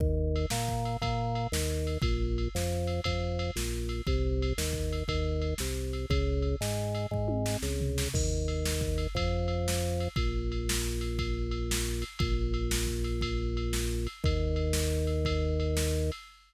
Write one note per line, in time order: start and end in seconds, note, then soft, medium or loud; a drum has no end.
0.00 0.46 D#2 medium
0.00 kick loud
0.36 ride medium
0.50 0.97 A#2 medium
0.50 snare loud
0.68 kick medium
0.85 ride medium
1.01 1.47 A#2 medium
1.01 kick medium
1.01 ride loud
1.35 ride medium
1.52 1.98 D#2 medium
1.52 snare loud
1.87 ride medium
2.02 2.48 A#1 medium
2.02 kick loud
2.02 ride loud
2.38 ride medium
2.55 3.01 F2 medium
2.55 snare loud
2.87 ride medium
3.04 3.51 F2 medium
3.04 kick medium
3.04 ride loud
3.39 ride medium
3.56 4.02 A#1 medium
3.56 snare loud
3.89 ride medium
4.07 4.53 C2 medium
4.07 kick loud
4.07 ride loud
4.42 ride medium
4.58 5.04 D#2 medium
4.58 snare loud
4.73 kick medium
4.92 ride medium
5.08 5.54 D#2 medium
5.08 kick medium
5.08 ride loud
5.42 ride medium
5.58 6.06 C2 medium
5.58 snare loud
5.93 ride medium
6.10 6.56 C#2 medium
6.10 kick loud
6.10 ride loud
6.42 ride medium
6.61 7.07 G#2 medium
6.61 snare loud
6.94 ride medium
7.11 7.57 G#2 medium
7.11 kick medium
7.28 high tom loud
7.46 snare loud
7.63 8.08 C#2 medium
7.63 snare medium
7.80 floor tom loud
7.98 snare loud
8.14 9.07 D#2 medium
8.14 kick loud
8.14 crash loud
8.48 ride medium
8.65 snare loud
8.81 kick loud
8.98 ride medium
9.15 10.08 F2 medium
9.15 kick loud
9.15 ride loud
9.48 ride medium
9.68 snare loud
10.00 ride medium
10.16 12.04 A#1 medium
10.16 kick loud
10.16 ride loud
10.52 ride medium
10.69 snare loud
11.01 ride medium
11.19 kick loud
11.19 ride loud
11.51 ride medium
11.71 snare loud
12.02 ride medium
12.19 14.07 A#1 medium
12.19 kick loud
12.19 ride loud
12.54 ride medium
12.71 snare loud
12.87 kick medium
13.04 ride medium
13.21 kick medium
13.21 ride loud
13.57 ride medium
13.73 snare loud
14.07 ride medium
14.24 16.11 D#2 medium
14.24 kick loud
14.24 ride loud
14.56 ride medium
14.73 snare loud
15.07 ride medium
15.25 kick medium
15.25 ride loud
15.60 ride medium
15.77 snare loud
16.12 ride medium